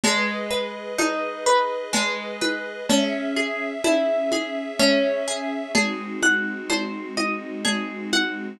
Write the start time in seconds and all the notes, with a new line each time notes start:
0.04 G#3 G#4 B4 D#5, cowbell, low conga
0.51 B4
0.98 D#4, cowbell, high conga
1.46 B4
1.93 G#3, cowbell, low conga
2.41 B4, high conga
2.89 C#4 G#4 E5, cowbell, low conga
3.37 G#4
3.84 E4, cowbell, high conga
4.32 G#4, high conga
4.79 C#4, cowbell, low conga
5.28 G#4
5.75 G#3 C4 D#4 F#4 G#4, cowbell, low conga
6.22 F#5, high conga
6.70 C5, cowbell, high conga
7.17 D#5, high conga
7.65 G#4, cowbell, low conga
8.13 F#5, high conga